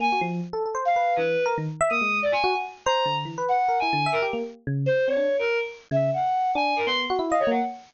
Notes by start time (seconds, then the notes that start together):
0.00 A#3 G#5
0.12 F#4
0.21 F3
0.53 A4
0.66 A4
0.75 C5
0.85 F5
0.96 B4
1.16 E3 B4
1.46 A#4
1.58 D#3
1.81 E5
1.90 A#3 D#6
2.01 G#3
2.22 D5
2.32 G#5
2.44 F#4
2.55 F#4
2.85 C5 A#5
3.06 D3
3.25 E3
3.38 B4
3.48 F#5
3.68 A#4
3.79 E4 G#5
3.93 D3
4.06 E5
4.12 A#4
4.22 G4
4.33 A#3
4.67 C#3
4.86 C5
5.07 C4 C#5
5.17 D4
5.39 A#4
5.91 C#3 E5
6.13 F#5
6.55 D4 G#5
6.76 A#4
6.86 B3 C6
7.10 F#4
7.19 E4
7.29 D#5 F5
7.39 C#5
7.47 A#3 F#5